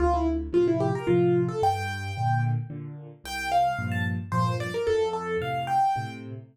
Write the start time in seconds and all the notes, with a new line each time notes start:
0.00 D2 F4
0.14 E4
0.53 A2 C3 F3 F4
0.68 E4
0.80 G4
0.95 A#4
1.07 A2 C3 F3 F4
1.49 A4
1.62 G2 G5
2.17 A#2 D3
2.70 A#2 D3
3.24 C2 G5
3.52 F5
3.79 G2 A#2 F3
3.92 A5
4.32 G2 A#2 F3 C5
4.60 D5
4.74 A#4
4.87 F2 A4
5.13 A4
5.41 A2 C3 F5
5.67 G5
5.96 A2 C3